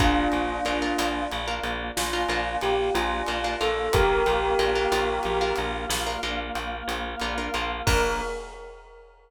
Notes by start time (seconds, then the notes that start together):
0.00 A#1 A#3 D4 F4 A#4, kick, closed hi-hat
0.32 A#1, closed hi-hat
0.65 A#1 D4 F4 A#4, closed hi-hat
0.82 D4 F4 A#4
0.98 A#1 D4 F4 A#4, closed hi-hat
1.32 A#1, closed hi-hat
1.48 D4 F4 A#4
1.63 A#1, closed hi-hat
1.97 A#1 F4, snare
2.13 D4 F4 A#4
2.28 A#1 D4 F4 A#4, closed hi-hat
2.61 A#1 G4, closed hi-hat
2.95 A#1 F4, closed hi-hat
3.27 A#1 D4 F4 A#4, closed hi-hat
3.44 D4 F4 A#4
3.61 A#1 D4 F4 A4 A#4, closed hi-hat
3.93 A#1 A#3 F4 G4 A#4, kick, closed hi-hat
4.26 A#1, closed hi-hat
4.59 A#1 D4 F4 A#4, closed hi-hat
4.75 D4 F4 A#4
4.92 A#1 D4 F4 A#4, closed hi-hat
5.23 A#1, closed hi-hat
5.41 D4 F4 A#4
5.56 A#1, closed hi-hat
5.89 A#1, snare
6.07 D4 F4 A#4
6.23 A#1 D4 F4 A#4, closed hi-hat
6.55 A#1, closed hi-hat
6.88 A#1, closed hi-hat
7.20 A#1 D4 F4 A#4, closed hi-hat
7.38 D4 F4 A#4
7.54 A#1 D4 F4 A#4, closed hi-hat
7.87 A#1 A#3 D4 F4 A#4, kick, crash